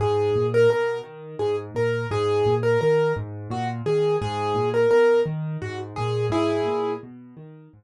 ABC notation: X:1
M:6/8
L:1/16
Q:3/8=57
K:G#m
V:1 name="Acoustic Grand Piano"
G3 A A2 z2 G z A2 | G3 A A2 z2 F z G2 | G3 A A2 z2 F z G2 | [EG]4 z8 |]
V:2 name="Acoustic Grand Piano" clef=bass
G,,2 A,,2 B,,2 D,2 G,,2 A,,2 | G,,2 A,,2 D,2 G,,2 A,,2 D,2 | G,,2 A,,2 B,,2 D,2 G,,2 A,,2 | G,,2 A,,2 B,,2 D,2 G,,2 z2 |]